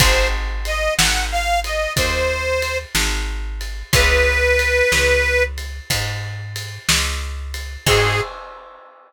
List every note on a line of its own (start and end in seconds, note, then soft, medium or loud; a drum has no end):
0.00 0.89 G#1 loud
0.00 3.55 C4 loud
0.00 3.55 D#4 loud
0.00 3.55 F#4 loud
0.00 3.55 G#4 loud
0.00 0.28 C5 loud
0.00 kick loud
0.00 ride loud
0.65 0.94 D#5 medium
0.65 ride medium
0.98 1.87 G#1 medium
0.98 1.25 F#5 medium
0.98 snare loud
1.32 1.60 F5 loud
1.64 1.93 D#5 medium
1.64 ride medium
1.96 2.85 D#2 medium
1.96 2.78 C5 medium
1.96 kick loud
1.96 ride loud
2.62 ride medium
2.95 3.83 G#1 medium
2.95 snare loud
3.61 ride medium
3.93 4.82 C#2 loud
3.93 7.47 B3 loud
3.93 7.47 C#4 loud
3.93 7.47 F4 loud
3.93 7.47 G#4 medium
3.93 5.43 B4 loud
3.93 kick loud
3.93 ride loud
4.59 ride medium
4.92 5.80 C#2 medium
4.92 snare loud
5.58 ride medium
5.90 6.79 G#2 medium
5.90 kick medium
5.90 ride loud
6.56 ride medium
6.89 7.77 C#2 medium
6.89 snare loud
7.54 ride medium
7.86 8.21 G#2 loud
7.86 8.21 C4 loud
7.86 8.21 D#4 medium
7.86 8.21 F#4 loud
7.86 8.21 G#4 loud
7.86 8.21 G#4 medium
7.86 kick loud
7.86 crash loud